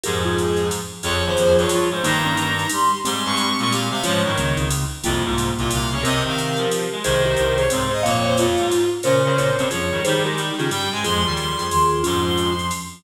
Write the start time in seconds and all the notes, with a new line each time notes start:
0.03 F2 G#2 F3 G4 G#4 A#4, ride
0.24 F4 G#4
0.37 G#4, hi-hat pedal, ride
0.57 ride
0.71 ride
1.03 F2 F3 F4 G#4 C#5, kick, ride
1.25 D#2 C5
1.36 F2 F3, hi-hat pedal, ride
1.58 G2 C#5, ride
1.69 F3 F4, ride
1.91 G#2 C5
2.02 G2 D#3 G3 A#3 D#4 A#5, kick, ride
2.25 A#3 C#4
2.37 D#3 D#4, hi-hat pedal, ride
2.59 ride
2.69 G3 G4 C6, ride
3.04 G#2 G3 G#3 C4 G4 C6, ride
3.25 G2 C#6
3.37 G3 G4, hi-hat pedal, ride
3.59 A#2 C#6, ride
3.70 G3 G4 F5, ride
3.91 C3 F5
4.03 G#2 F3 G#3 C#4 F4 C#5, ride
4.23 G2 D#3 G3 C#5
4.36 C#2 C#3 A#3 C#4, hi-hat pedal, ride
4.57 C#2 C#3 C4 D#4, ride
4.70 ride
5.04 C2 F2 C3 G3 A#3 F4, ride
5.24 C2 G#2 C3 F4
5.38 hi-hat pedal, ride
5.57 C2 A#2 C3 F4, ride
5.71 C2 C3 F5, ride
5.91 C#3 C#5
6.03 C3 C4 G4 A#4 D#5, kick, ride
6.25 D#3 F5
6.38 hi-hat pedal, ride
6.57 F3, ride
6.71 ride
6.92 G#3
7.04 C2 C3 D#3 G#4 C5, ride
7.25 G4 A#4
7.36 C2 C3 C5, hi-hat pedal, ride
7.57 G#4 C5 C#5, ride
7.70 G#2 C3 C4 C5, ride
7.91 G#4 C5 D#5
8.03 F2 A#2 A#3 C#5 F5, kick, ride
8.24 C5 C#5 F5
8.37 F2 F4, hi-hat pedal, ride
8.57 G#2, ride
8.71 ride
9.03 A#2 C#3 C#4 A#4 C5 C#5, ride
9.24 C#3 A#4 C#5
9.37 A#2 A#4 C#5, kick, hi-hat pedal, ride
9.57 G2 C3 C4, ride
9.71 F2 F3 F4 G#4 C#5, ride
9.90 G2 D#3 G3
10.04 D#3 G3 D#4 G4 G#4 C5, ride
10.24 G#3 G4 A#4
10.37 G3, hi-hat pedal, ride
10.57 C#3 D#3 C#4 F4 G#4, ride
10.69 G2 G3 G5, ride
10.91 G#2 G#3 G#5
11.04 F2 F3 G#3 F4 G#4 C6, ride
11.25 D#2 D#3 G3 F4 G#4
11.37 C6, hi-hat pedal, ride
11.58 F2 F3 F4 G#4, ride
11.70 D#2 D#3 C6, ride
12.03 F2 G#2 F3 C#4 F4 C6, ride
12.25 C6
12.38 hi-hat pedal, ride
12.59 ride
12.71 ride